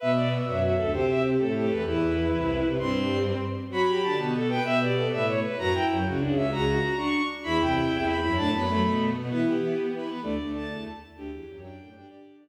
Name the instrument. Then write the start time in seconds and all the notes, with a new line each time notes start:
violin
0.00 B2 B3 B4 E5
0.16 D5
0.45 F#2 F#3 F#4
0.61 F#4
0.76 D2 D3 A4
0.92 C3 C4 G4 C5
1.09 E5
1.38 A2 A3 A4
1.54 G4 A4
1.69 E2 E3 B4
1.86 E2 E3 E4 B4
2.33 C2 C3
2.64 C2 C3
2.79 G2 G3 C4 C6
3.70 F#3 F#4 B5
3.88 G4
4.03 D3 D4 A5
4.17 B2 B3 F#4
4.35 A4
4.49 B4 G5
4.64 B2 B3 B4 E5
4.81 G4 D5
4.96 A4
5.11 A2 A3 B4 E5
5.27 C#5
5.44 B4
5.58 F#2 F#3 F#4 A#5
5.73 E4 G5
5.90 F#2 F#3
6.05 C#2 C#3 F#4
6.19 C#2 C#3 D4
6.35 C#4 E5
6.51 C#2 C#3 F#4 A#5
6.67 F#4
6.83 F#4
6.96 D4 C#6
7.43 E2 E3 E4 B5
7.60 C2 C3 G5
7.76 C2 C3
7.91 E2 E3
8.06 B5
8.22 F#2 F#3 E4 B5
8.36 A2 A3 D4 A5
8.53 F#2 F#3 B3 B5
8.67 F#2 F#3 A3
8.83 B2 B3
9.14 B2 B3
9.29 E3 B3 E4 B4
9.46 G4
9.59 E3 E4
9.93 E3 E4 B4
10.07 B3 B4
10.22 D2 D3 A3 D5
10.38 D2 D3 A3
10.54 A5
10.71 E2 E3
11.16 D2 D3 G4
11.31 E2 E3
11.49 F#2 F#3
11.62 D4 G5
11.80 A2 A3
11.94 G2 G3 D4 G5
12.08 D3 D4 G4 D5
12.41 D4